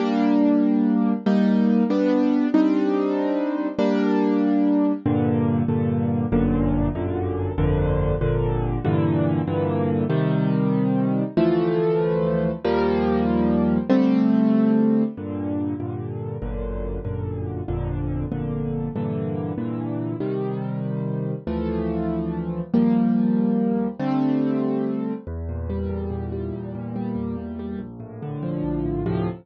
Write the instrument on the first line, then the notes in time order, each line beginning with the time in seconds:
acoustic grand piano
0.00 G3 A#3 D4
1.26 G3 A#3 D#4
1.90 G3 B3 D4
2.54 G3 C4 D4 D#4
3.79 G3 A#3 D4
5.06 G2 A#2 D3
5.68 G2 A#2 D3
6.32 G1 F#2 A#2 D3
6.95 G1 F#2 A#2 D3
7.58 G1 F2 A#2 D3
8.21 G1 F2 A#2 D3
8.85 G2 A#2 D3 E3
9.47 G2 A#2 D3 E3
10.10 C3 D#3 G3
11.37 D2 E3 F3 A3
12.64 D#2 F3 G3 A#3
13.90 D3 G3 A3 C4
15.17 G2 A#2 D3
15.80 G2 A#2 D3
16.42 G1 F#2 A#2 D3
17.05 G1 F#2 A#2 D3
17.68 G1 F2 A#2 D3
18.32 G1 F2 A#2 D3
18.96 G2 A#2 D3 E3
19.58 G2 A#2 D3 E3
20.20 C3 D#3 G3
21.47 D2 E3 F3 A3
22.74 D#2 F3 G3 A#3
23.99 D3 G3 A3 C4
25.27 E2
25.49 A#2
25.70 G3
25.89 E2
26.10 A#2
26.32 G3
26.53 E2
26.75 A#2
26.96 G3
27.15 E2
27.37 A#2
27.59 G3
27.79 A#1
28.00 A2
28.22 D3
28.43 F3
28.64 A#1
28.85 A2
29.06 D2 A2 C3 F3